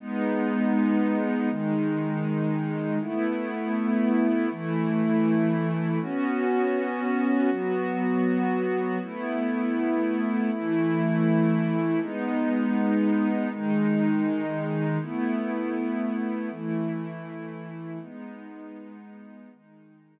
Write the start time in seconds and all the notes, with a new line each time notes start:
0.00 G#3 B3 D#4
1.50 D#3 G#3 D#4
3.01 A3 B3 E4
4.51 E3 A3 E4
6.01 B3 C#4 F#4
7.50 F#3 B3 F#4
9.01 A3 B3 E4
10.51 E3 A3 E4
12.01 G#3 B3 D#4
13.49 D#3 G#3 D#4
15.01 A3 B3 E4
16.50 E3 A3 E4
18.01 G#3 B3 D#4
19.51 D#3 G#3 D#4